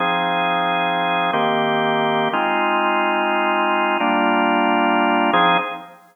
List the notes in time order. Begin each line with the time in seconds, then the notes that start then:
0.00 F3 C4 D#4 G#4
1.33 D#3 A#3 C4 G4
2.33 G#3 C4 D#4 F4
4.00 G3 A#3 D4 F4
5.33 F3 C4 D#4 G#4